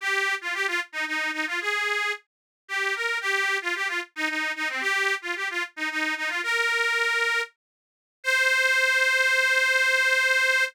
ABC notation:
X:1
M:3/4
L:1/16
Q:1/4=112
K:Cm
V:1 name="Accordion"
G3 F G F z E E2 E F | A4 z4 G2 B2 | G3 F G F z E E2 E C | G3 F G F z E E2 E F |
"^rit." B8 z4 | c12 |]